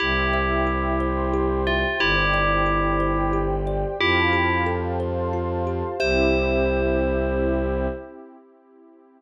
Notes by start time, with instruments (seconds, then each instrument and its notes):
0.00 violin C2, tubular bells E4 G4, kalimba G4, pad 2 (warm) C5 E5 G5
0.33 kalimba E5
0.67 kalimba G4
1.00 kalimba C5, pad 2 (warm) C5 G5 C6
1.33 kalimba G4
1.67 tubular bells F4, kalimba E5
1.99 violin G1, tubular bells E4 G4, kalimba G4, pad 2 (warm) C5 D5 G5
2.34 kalimba D5
2.66 kalimba G4
3.00 pad 2 (warm) G4 C5 G5, kalimba C5
3.33 kalimba G4
3.67 kalimba D5
3.99 violin F2, tubular bells E4 G4, kalimba F4, pad 2 (warm) C5 F5 G5 A5
4.33 kalimba G4
4.66 kalimba A4
4.99 pad 2 (warm) C5 F5 A5 C6, kalimba C5
5.33 kalimba F4
5.67 kalimba G4
5.99 violin C2, pad 2 (warm) C4 E4 G4, kalimba G4 C5 E5, tubular bells C5